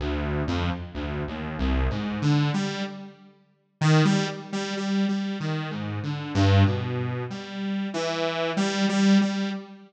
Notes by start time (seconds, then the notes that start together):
0.00 D2
0.48 F2
0.94 D2
1.28 D#2
1.59 C2
1.90 G#2
2.22 D3
2.54 G3
3.81 D#3
4.05 G3
4.53 G3
4.77 G3
5.09 G3
5.40 D#3
5.71 G#2
6.03 D3
6.35 G2
6.66 B2
7.30 G3
7.94 E3
8.57 G3
8.89 G3
9.21 G3